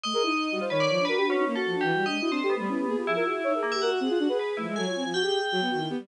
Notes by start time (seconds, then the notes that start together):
0.04 A3 D#5
0.13 G#4 A#4
0.23 D#4 E4
0.51 G3 F#4
0.61 F4 C5
0.70 D#3 B4 C#5
0.80 D5
0.90 F3
0.99 D4
1.05 F#4 A#4 B4
1.17 D4 G4
1.27 C#4 F#4
1.36 D#4
1.46 A#3 D#4
1.56 F#4 A4
1.65 F3
1.74 D4
1.81 E3 G4
1.93 G3
2.05 D4 D#5
2.12 G#3
2.19 E4 F#4
2.30 C4 D4 C5
2.40 G4 A4
2.50 B3
2.56 G3 A3
2.69 C#4 E4
2.78 G4
2.87 A#3 G#4
2.97 F4 G4
3.06 F3 E4 G#4
3.16 F4 A#4
3.25 F#4 G#4
3.35 E4
3.44 D#4 C#5
3.54 G#4 A#4
3.63 A#3
3.72 G4 E5
3.82 F#4 A#4 F#5
3.91 F#4
4.00 C4 G#4
4.10 F4
4.19 D4 F#4
4.28 G#4 B4
4.39 B4
4.57 F3 A3 E4
4.67 G#3
4.76 F#3 A4 G#5
4.86 F4 C#5
4.95 C4
5.04 F3 F4
5.14 F#4 G5
5.23 G4 G#4
5.52 F#3 F#4
5.61 B3
5.71 D#3 F#4
5.80 E4
5.90 B3 G4
5.99 G3